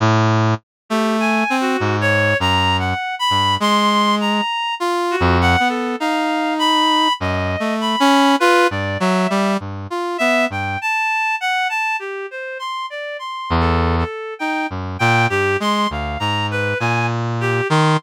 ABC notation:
X:1
M:3/4
L:1/16
Q:1/4=50
K:none
V:1 name="Brass Section"
A,,2 z A,2 C _A,,2 _G,,2 z =G,, | _A,3 z (3F2 F,,2 B,2 _E4 | (3_G,,2 A,2 _D2 F =G,, _G, =G, G,, F B, G,, | z9 E,,2 z |
_E _G,, _B,, =G,, _A, D,, _A,,2 B,,3 _E, |]
V:2 name="Clarinet"
z3 G (3_a2 _G2 _d2 (3_b2 _g2 =b2 | c'2 _b2 z _G _g A f2 =b2 | _e2 b2 B d =e2 z2 e g | a2 _g a =G c c' d (3c'2 A2 A2 |
g z g G c' f _b =B _a z G c' |]